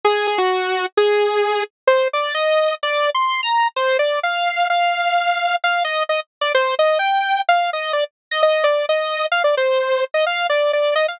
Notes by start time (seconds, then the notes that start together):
0.05 G#4
0.27 G#4
0.38 F#4
0.97 G#4
1.87 C5
2.13 D5
2.34 D#5
2.83 D5
3.15 C6
3.43 A#5
3.76 C5
3.99 D5
4.23 F5
4.70 F5
5.64 F5
5.84 D#5
6.09 D#5
6.41 D5
6.55 C5
6.79 D#5
6.99 G5
7.49 F5
7.73 D#5
7.93 D5
8.31 D#5
8.43 D#5
8.64 D5
8.89 D#5
9.32 F5
9.44 D5
9.57 C5
10.14 D#5
10.26 F5
10.50 D5
10.73 D5
10.95 D#5
11.08 F5